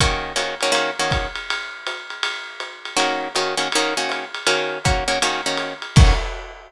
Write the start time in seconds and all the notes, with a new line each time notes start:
0.00 D#3 A#3 C#4 F#4, kick, ride
0.36 D#3 A#3 C#4 F#4, hi-hat pedal, ride
0.61 D#3 A#3 C#4 F#4, ride
0.72 D#3 A#3 C#4 F#4, ride
0.99 D#3 A#3 C#4 F#4
1.10 kick, hi-hat pedal, ride
1.35 ride
1.50 ride
1.87 hi-hat pedal, ride
2.10 ride
2.23 ride
2.60 hi-hat pedal, ride
2.85 ride
2.97 D#3 A#3 C#4 F#4, ride
3.35 D#3 A#3 C#4 F#4, hi-hat pedal, ride
3.57 D#3 A#3 C#4 F#4, ride
3.72 D#3 A#3 C#4 F#4, ride
3.97 D#3 A#3 C#4 F#4
4.09 hi-hat pedal, ride
4.34 ride
4.47 D#3 A#3 C#4 F#4, ride
4.84 D#3 A#3 C#4 F#4, kick, hi-hat pedal, ride
5.08 D#3 A#3 C#4 F#4, ride
5.22 D#3 A#3 C#4 F#4, ride
5.46 D#3 A#3 C#4 F#4
5.57 hi-hat pedal, ride
5.82 ride
5.96 D#3 A#3 C#4 F#4, kick, crash